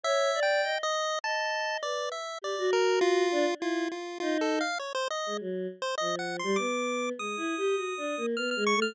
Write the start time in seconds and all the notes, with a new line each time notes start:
0.04 C#5 E5
0.35 D5
0.43 G5
0.63 D#5
0.83 D#5
1.24 D#5 A5
1.82 B4 D5
2.12 E5
2.42 G4 D5
2.58 F#4
2.73 A#4
3.01 F4
3.32 D4
3.60 E4 F4
3.92 F4
4.20 D#4 F4
4.41 A4
4.61 F5
4.79 C#5
4.95 C5
5.11 D#5
5.26 G#3
5.40 F#3
5.82 C5
5.98 F3 D#5
6.19 F#5
6.39 G3 C6
6.56 B3 D6
7.18 G#3 D#6
7.37 E4
7.57 G4
7.76 F#4
7.97 D4
8.17 A#3
8.37 B3 F6
8.51 F6
8.56 G#3
8.67 C#6
8.76 A3
8.82 F6